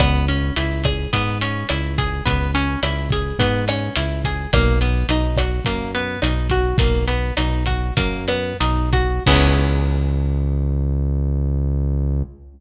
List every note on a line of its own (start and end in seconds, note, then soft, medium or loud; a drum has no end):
0.00 0.51 C#2 medium
0.00 0.26 B3 loud
0.00 kick loud
0.00 cross-stick loud
0.00 closed hi-hat loud
0.28 0.54 C#4 medium
0.28 closed hi-hat medium
0.56 1.07 C#2 medium
0.56 0.82 E4 medium
0.56 closed hi-hat loud
0.84 1.10 G#4 medium
0.84 kick medium
0.84 cross-stick loud
0.84 closed hi-hat medium
1.13 1.64 G#2 medium
1.13 1.38 B3 medium
1.13 kick medium
1.13 closed hi-hat loud
1.41 1.67 C#4 medium
1.41 closed hi-hat loud
1.69 2.21 C#2 medium
1.69 1.96 E4 medium
1.69 cross-stick loud
1.69 closed hi-hat loud
1.98 2.24 G#4 medium
1.98 kick medium
1.98 closed hi-hat medium
2.26 2.77 C#2 medium
2.26 2.51 B3 medium
2.26 kick loud
2.26 closed hi-hat loud
2.55 2.80 C#4 medium
2.55 closed hi-hat medium
2.83 3.33 C#2 medium
2.83 3.09 E4 medium
2.83 cross-stick loud
2.83 closed hi-hat loud
3.10 3.38 G#4 medium
3.10 kick loud
3.10 closed hi-hat medium
3.39 3.90 G#2 medium
3.39 3.65 B3 medium
3.39 kick medium
3.39 closed hi-hat loud
3.68 3.94 C#4 medium
3.68 cross-stick loud
3.68 closed hi-hat medium
3.96 4.47 C#2 medium
3.96 4.22 E4 medium
3.96 closed hi-hat loud
4.24 4.51 G#4 medium
4.24 kick medium
4.24 closed hi-hat medium
4.53 5.04 B1 medium
4.53 4.79 A#3 loud
4.53 kick loud
4.53 cross-stick loud
4.53 closed hi-hat loud
4.81 5.07 B3 medium
4.81 closed hi-hat medium
5.09 5.60 B1 medium
5.09 5.36 D#4 medium
5.09 closed hi-hat loud
5.36 5.64 F#4 medium
5.36 kick medium
5.36 cross-stick loud
5.36 closed hi-hat loud
5.65 6.17 F#2 medium
5.65 5.91 A#3 medium
5.65 kick medium
5.65 closed hi-hat loud
5.95 6.20 B3 medium
5.95 closed hi-hat medium
6.22 6.74 B1 medium
6.22 6.48 D#4 medium
6.22 cross-stick loud
6.22 closed hi-hat loud
6.50 6.77 F#4 medium
6.50 kick medium
6.50 closed hi-hat medium
6.78 7.32 B1 medium
6.78 7.05 A#3 medium
6.78 kick loud
6.78 closed hi-hat loud
7.08 7.34 B3 medium
7.08 closed hi-hat medium
7.37 7.92 B1 medium
7.37 7.64 D#4 medium
7.37 cross-stick medium
7.37 closed hi-hat loud
7.66 7.94 F#4 medium
7.66 kick medium
7.66 closed hi-hat medium
7.97 8.54 F#2 medium
7.97 8.25 A#3 medium
7.97 kick loud
7.97 closed hi-hat loud
8.28 8.57 B3 medium
8.28 cross-stick medium
8.28 closed hi-hat medium
8.60 9.20 B1 medium
8.60 8.90 D#4 medium
8.60 closed hi-hat loud
8.93 9.23 F#4 medium
8.93 kick medium
8.93 closed hi-hat medium
9.26 12.23 C#2 loud
9.26 12.22 B3 loud
9.26 12.22 C#4 loud
9.26 12.22 E4 loud
9.26 12.22 G#4 medium
9.26 kick loud
9.26 crash loud